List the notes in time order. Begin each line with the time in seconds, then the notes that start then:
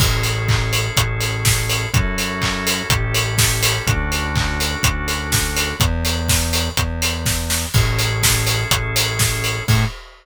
0.00 A1 C#4 E4 G#4 A4, kick, crash
0.23 open hi-hat
0.48 kick, clap
0.73 open hi-hat
0.97 A1, kick, closed hi-hat
1.21 open hi-hat
1.45 kick, snare
1.69 open hi-hat
1.93 F#2 C#4 E4 F#4 A4, kick, closed hi-hat
2.18 open hi-hat
2.42 kick, clap
2.67 open hi-hat
2.90 A1 C#4 E4 G4 A4, kick, closed hi-hat
3.14 open hi-hat
3.38 kick, snare
3.63 open hi-hat
3.86 D2 C#4 D4 F#4 A4, kick, closed hi-hat
4.12 open hi-hat
4.35 kick, clap
4.60 open hi-hat
4.83 D2, kick, closed hi-hat
5.08 open hi-hat
5.32 kick, snare
5.56 open hi-hat
5.80 E2, kick, closed hi-hat
6.05 open hi-hat
6.29 kick, snare
6.53 open hi-hat
6.77 E2, kick, closed hi-hat
7.02 open hi-hat
7.26 kick, snare
7.50 snare
7.74 A1 C#4 E4 G#4 A4, kick, crash
7.99 open hi-hat
8.23 kick, snare
8.47 open hi-hat
8.71 A1, kick, closed hi-hat
8.96 open hi-hat
9.19 kick, snare
9.44 open hi-hat
9.68 A2 C#4 E4 G#4 A4, kick, crash